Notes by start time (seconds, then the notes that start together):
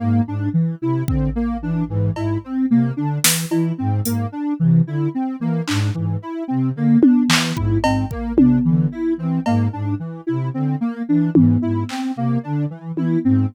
0.00 G#2 A#3
0.27 G#2 D4
0.54 E3
0.82 C3 E4
1.08 D3 C4, kick
1.36 A#3
1.62 E3 D4
1.89 G#2 E3
2.16 G#2 E4, cowbell
2.44 C4
2.70 C3 A#3
2.97 D3 D4
3.24 E3, snare
3.51 E3 E4, cowbell
3.78 G#2 C4
4.05 G#2 A#3, closed hi-hat
4.32 D4
4.60 C3 E3
4.86 D3 E4
5.15 C4
5.40 E3 A#3
5.67 G#2 D4, clap
5.94 G#2 E3
6.22 E4
6.48 C3 C4
6.75 D3 A#3
7.02 D4, high tom
7.29 E3, clap
7.56 G#2 E4, kick
7.83 G#2 C4, cowbell
8.11 A#3, kick
8.37 C3 D4, high tom
8.65 D3 E3
8.92 E4
9.17 E3 C4
9.46 G#2 A#3, cowbell
9.73 G#2 D4
10.00 E3
10.27 C3 E4
10.54 D3 C4
10.81 A#3
11.08 E3 D4
11.35 G#2 E3, high tom
11.62 G#2 E4
11.89 C4, clap
12.16 C3 A#3
12.43 D3 D4
12.70 E3
12.95 E3 E4, high tom
13.24 G#2 C4